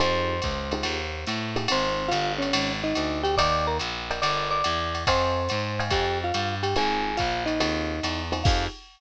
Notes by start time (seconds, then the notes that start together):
0.00 F2 D#4 F4 G4 G#4 C5 C6, ride
0.42 C#2, kick, hi-hat pedal, ride
0.71 D#4 F4 G4 G#4, ride
0.83 D#2, ride
1.27 A2, hi-hat pedal, ride
1.56 D#4 F4 G4 G#4, ride
1.68 G#1 C4 D#4 F4 G#4 C5 C6, ride
2.08 G1 F4 F5, ride
2.12 hi-hat pedal
2.38 C#4 C#5, ride
2.53 G#1, ride
2.84 D#4 D#5
2.95 D2, hi-hat pedal, ride
3.23 G4 G5, ride
3.37 D#2 A#4 D5 D#5 G5 D6, kick, ride
3.67 A#4 A#5
3.79 A#1, hi-hat pedal, ride
4.11 A#4 D5 D#5 G5, ride
4.22 G1 A#4 D5 D#5 G5 D6, ride
4.51 D5 D6
4.64 E2, hi-hat pedal, ride
4.95 ride
5.07 F2 C5 D#5 F5 G5 G#5 C6, kick, ride
5.49 G#2, hi-hat pedal, ride
5.79 D#5 F5 G5 G#5, ride
5.90 F2 G4 G5, kick, ride
6.24 F4 F5
6.34 G2, hi-hat pedal, ride
6.63 G4 G5, ride
6.76 G#1 C4 D#4 F4 G#4 G#5, ride
7.17 A#1 F4 F5, kick, hi-hat pedal, ride
7.46 D#4 D#5, ride
7.60 D#2 C4 D#4 F4 G#4, ride
8.03 E2, hi-hat pedal, ride
8.32 C4 D#4 F4 G#4, ride
8.44 F2 D#4 F4 G4 G#4 F5, kick, crash